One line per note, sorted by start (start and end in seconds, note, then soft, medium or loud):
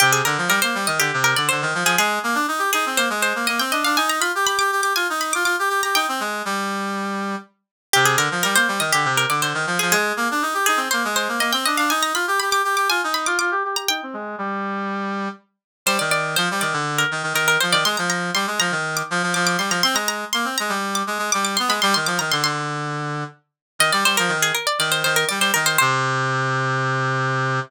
0.00 0.22 C3 medium
0.00 0.12 G4 medium
0.13 0.24 G#4 medium
0.25 0.37 D3 medium
0.25 0.45 A#4 medium
0.38 0.49 F3 medium
0.48 0.60 G3 medium
0.48 0.61 A#4 medium
0.62 0.75 A#3 medium
0.62 0.84 C5 medium
0.75 0.86 G3 medium
0.87 0.99 D#3 medium
0.87 0.99 D#5 medium
0.99 1.11 D3 medium
0.99 1.20 G4 medium
1.13 1.34 C3 medium
1.24 1.36 A#4 medium
1.36 1.49 D3 medium
1.36 1.48 D5 medium
1.49 1.63 D3 medium
1.49 1.72 C5 medium
1.62 1.74 D#3 medium
1.74 1.84 F3 medium
1.84 1.96 F3 medium
1.84 1.98 G#4 medium
1.98 2.19 G#3 medium
1.98 2.67 G#4 medium
2.23 2.35 A#3 medium
2.35 2.46 D4 medium
2.48 2.60 D#4 medium
2.59 2.70 G4 medium
2.73 2.85 D#4 medium
2.73 2.96 G#4 medium
2.86 2.98 C4 medium
2.97 3.09 A#3 medium
2.97 3.09 C5 medium
3.10 3.33 G#3 medium
3.22 3.46 C5 medium
3.35 3.47 A#3 medium
3.47 3.60 A#3 medium
3.47 3.59 D#5 medium
3.59 3.71 C4 medium
3.59 3.71 G5 medium
3.72 3.84 D4 medium
3.72 3.84 D#5 medium
3.85 3.97 D4 medium
3.85 3.96 F5 medium
3.97 4.20 D#4 medium
3.97 4.09 G#5 medium
4.10 4.21 A#5 medium
4.20 4.32 F4 medium
4.20 4.45 B5 medium
4.35 4.46 G4 medium
4.46 4.58 G4 medium
4.46 4.58 B5 medium
4.59 4.71 G4 medium
4.59 4.81 D6 medium
4.72 4.81 G4 medium
4.81 4.93 G4 medium
4.81 4.95 D6 medium
4.96 5.07 F4 medium
4.96 5.18 G#5 medium
5.10 5.33 D#4 medium
5.21 5.33 B5 medium
5.33 5.44 F4 medium
5.33 5.45 D6 medium
5.44 5.56 F4 medium
5.44 5.68 D6 medium
5.59 5.69 G4 medium
5.69 5.81 G4 medium
5.83 5.95 G4 medium
5.83 5.95 A#5 medium
5.95 6.07 D#4 medium
5.95 7.24 G5 medium
6.08 6.20 C4 medium
6.20 6.42 G#3 medium
6.45 7.36 G3 medium
7.93 8.16 C3 medium
7.93 8.05 G4 medium
8.05 8.17 G#4 medium
8.17 8.29 D3 medium
8.17 8.38 A#4 medium
8.31 8.43 F3 medium
8.43 8.56 G3 medium
8.43 8.55 A#4 medium
8.55 8.67 A#3 medium
8.55 8.78 C5 medium
8.68 8.80 G3 medium
8.80 8.91 D#3 medium
8.80 8.92 D#5 medium
8.92 9.05 D3 medium
8.92 9.13 G4 medium
9.05 9.25 C3 medium
9.17 9.29 A#4 medium
9.29 9.41 D3 medium
9.29 9.42 D5 medium
9.42 9.54 D3 medium
9.42 9.65 C5 medium
9.54 9.66 D#3 medium
9.67 9.78 F3 medium
9.79 9.93 F3 medium
9.79 9.91 G#4 medium
9.92 10.13 G#3 medium
9.92 10.60 G#4 medium
10.17 10.28 A#3 medium
10.31 10.43 D4 medium
10.42 10.54 D#4 medium
10.54 10.66 G4 medium
10.66 10.79 D#4 medium
10.66 10.89 G#4 medium
10.77 10.88 C4 medium
10.91 11.04 A#3 medium
10.91 11.03 C5 medium
11.05 11.28 G#3 medium
11.16 11.40 C5 medium
11.29 11.39 A#3 medium
11.40 11.52 A#3 medium
11.40 11.52 D#5 medium
11.52 11.65 C4 medium
11.52 11.64 G5 medium
11.65 11.78 D4 medium
11.65 11.77 D#5 medium
11.77 11.90 D4 medium
11.77 11.89 F5 medium
11.90 12.13 D#4 medium
11.90 12.02 G#5 medium
12.03 12.14 A#5 medium
12.14 12.26 F4 medium
12.14 12.39 B5 medium
12.27 12.39 G4 medium
12.40 12.50 G4 medium
12.40 12.51 B5 medium
12.50 12.62 G4 medium
12.50 12.75 D6 medium
12.64 12.76 G4 medium
12.76 12.88 G4 medium
12.76 12.89 D6 medium
12.90 13.01 F4 medium
12.90 13.12 G#5 medium
13.04 13.27 D#4 medium
13.14 13.26 B5 medium
13.26 13.38 F4 medium
13.26 13.38 D6 medium
13.39 13.51 F4 medium
13.39 13.61 D6 medium
13.51 13.63 G4 medium
13.65 13.76 G4 medium
13.76 13.88 G4 medium
13.76 13.88 A#5 medium
13.88 14.01 D#4 medium
13.88 15.17 G5 medium
14.03 14.15 C4 medium
14.13 14.36 G#3 medium
14.38 15.29 G3 medium
15.86 15.98 G3 medium
15.86 15.99 C5 medium
15.99 16.36 D#3 medium
15.99 16.11 D5 medium
16.11 16.35 D5 medium
16.36 16.49 F3 medium
16.36 16.58 C5 medium
16.51 16.63 G3 medium
16.61 16.73 D#3 medium
16.61 16.93 D5 medium
16.73 17.04 D3 medium
16.98 17.29 A#4 medium
17.11 17.23 D#3 medium
17.23 17.33 D#3 medium
17.33 17.57 D#3 medium
17.33 17.47 A#4 medium
17.48 17.60 A#4 medium
17.61 17.74 F3 medium
17.61 17.72 C5 medium
17.72 17.84 D#3 medium
17.72 17.84 D5 medium
17.85 17.96 G#3 medium
17.85 17.97 C6 medium
17.97 18.31 F3 medium
17.97 18.09 A#5 medium
18.10 18.30 A#5 medium
18.34 18.46 G3 medium
18.34 18.57 C6 medium
18.47 18.59 G#3 medium
18.60 18.71 F3 medium
18.60 18.90 A#5 medium
18.71 19.02 D#3 medium
18.97 19.29 D6 medium
19.11 19.22 F3 medium
19.23 19.34 F3 medium
19.34 19.57 F3 medium
19.34 19.46 D6 medium
19.47 19.58 D6 medium
19.58 19.70 G3 medium
19.58 19.71 C6 medium
19.70 19.82 F3 medium
19.70 19.83 A#5 medium
19.83 19.95 C4 medium
19.83 19.95 C6 medium
19.94 20.25 G#3 medium
19.94 20.08 A#5 medium
20.08 20.31 A#5 medium
20.33 20.45 A#3 medium
20.33 20.57 C6 medium
20.45 20.56 C4 medium
20.58 20.71 G#3 medium
20.58 20.92 A#5 medium
20.69 21.03 G3 medium
20.95 21.26 D6 medium
21.07 21.18 G#3 medium
21.19 21.30 G#3 medium
21.32 21.57 G3 medium
21.32 21.44 D6 medium
21.45 21.56 D6 medium
21.57 21.71 B3 medium
21.57 21.69 C6 medium
21.68 21.80 G#3 medium
21.68 21.82 B5 medium
21.82 21.94 G3 loud
21.82 21.94 C6 medium
21.94 22.07 D#3 medium
21.94 22.06 C6 medium
22.06 22.18 F3 medium
22.06 22.18 D6 medium
22.19 22.31 D#3 medium
22.19 22.31 A#5 medium
22.32 22.43 D3 medium
22.32 22.43 C6 medium
22.43 23.24 D3 medium
22.43 23.36 C6 medium
23.79 23.91 D#3 medium
23.79 23.92 D#5 medium
23.92 24.04 G3 medium
23.92 24.04 D5 medium
24.05 24.16 G3 medium
24.05 24.17 C5 medium
24.17 24.30 F3 medium
24.17 24.38 A#4 medium
24.28 24.52 D#3 medium
24.42 24.54 G#4 medium
24.55 24.66 A#4 medium
24.67 24.79 D5 medium
24.79 25.03 D#3 medium
24.79 24.91 D5 medium
24.92 25.03 C5 medium
25.04 25.25 D#3 medium
25.04 25.16 C5 medium
25.16 25.28 A#4 medium
25.29 25.39 G3 medium
25.29 25.40 D5 medium
25.40 25.51 G3 medium
25.40 25.53 C5 medium
25.54 25.77 D#3 medium
25.54 25.66 A#4 medium
25.66 25.78 C5 medium
25.78 27.60 C3 loud
25.78 27.58 C5 loud